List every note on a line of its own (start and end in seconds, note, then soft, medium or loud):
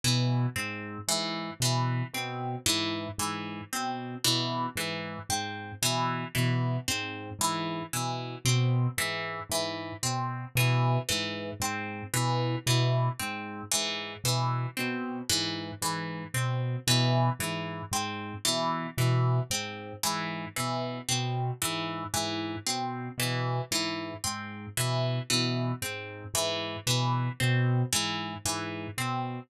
0.04 0.46 B2 medium
0.04 0.46 E3 medium
0.56 0.98 G#2 medium
0.56 0.98 C4 medium
1.08 1.50 G#2 medium
1.08 1.51 E3 medium
1.60 2.02 B2 medium
1.60 2.04 E3 medium
2.14 2.56 B2 medium
2.14 2.57 C4 medium
2.66 3.08 G#2 medium
2.66 3.08 E3 medium
3.18 3.61 G#2 medium
3.18 3.61 E3 medium
3.73 4.15 B2 medium
3.73 4.15 C4 medium
4.24 4.67 B2 medium
4.24 4.66 E3 medium
4.76 5.18 G#2 medium
4.76 5.19 E3 medium
5.29 5.71 G#2 medium
5.29 5.72 C4 medium
5.82 6.24 B2 medium
5.82 6.25 E3 medium
6.35 6.78 B2 medium
6.35 6.77 E3 medium
6.88 7.30 G#2 medium
6.88 7.30 C4 medium
7.39 7.81 G#2 medium
7.39 7.83 E3 medium
7.93 8.36 B2 medium
7.93 8.35 E3 medium
8.45 8.87 B2 medium
8.45 8.88 C4 medium
8.98 9.40 G#2 medium
8.98 9.40 E3 medium
9.49 9.91 G#2 medium
9.49 9.94 E3 medium
10.03 10.45 B2 medium
10.03 10.45 C4 medium
10.55 10.97 B2 medium
10.55 10.99 E3 medium
11.09 11.52 G#2 medium
11.09 11.51 E3 medium
11.60 12.02 G#2 medium
11.60 12.04 C4 medium
12.14 12.56 B2 medium
12.14 12.56 E3 medium
12.66 13.09 B2 medium
12.66 13.09 E3 medium
13.20 13.62 G#2 medium
13.20 13.62 C4 medium
13.71 14.15 G#2 medium
13.71 14.14 E3 medium
14.24 14.66 B2 medium
14.24 14.67 E3 medium
14.77 15.21 B2 medium
14.77 15.19 C4 medium
15.29 15.72 G#2 medium
15.29 15.71 E3 medium
15.82 16.24 G#2 medium
15.82 16.24 E3 medium
16.34 16.76 B2 medium
16.34 16.77 C4 medium
16.87 17.29 B2 medium
16.87 17.30 E3 medium
17.39 17.82 G#2 medium
17.39 17.82 E3 medium
17.91 18.34 G#2 medium
17.91 18.35 C4 medium
18.45 18.88 B2 medium
18.45 18.87 E3 medium
18.98 19.40 B2 medium
18.98 19.40 E3 medium
19.50 19.93 G#2 medium
19.50 19.93 C4 medium
20.03 20.46 G#2 medium
20.03 20.45 E3 medium
20.56 21.00 B2 medium
20.56 20.98 E3 medium
21.09 21.51 B2 medium
21.09 21.51 C4 medium
21.62 22.05 G#2 medium
21.62 22.04 E3 medium
22.14 22.56 G#2 medium
22.14 22.56 E3 medium
22.66 23.09 B2 medium
22.66 23.09 C4 medium
23.18 23.60 B2 medium
23.18 23.62 E3 medium
23.71 24.13 G#2 medium
23.71 24.14 E3 medium
24.24 24.66 G#2 medium
24.24 24.66 C4 medium
24.77 25.19 B2 medium
24.77 25.19 E3 medium
25.30 25.72 B2 medium
25.30 25.72 E3 medium
25.82 26.24 G#2 medium
25.82 26.24 C4 medium
26.34 26.76 G#2 medium
26.34 26.77 E3 medium
26.87 27.29 B2 medium
26.87 27.29 E3 medium
27.40 27.83 B2 medium
27.40 27.82 C4 medium
27.93 28.35 G#2 medium
27.93 28.35 E3 medium
28.45 28.87 G#2 medium
28.45 28.88 E3 medium
28.98 29.40 B2 medium
28.98 29.40 C4 medium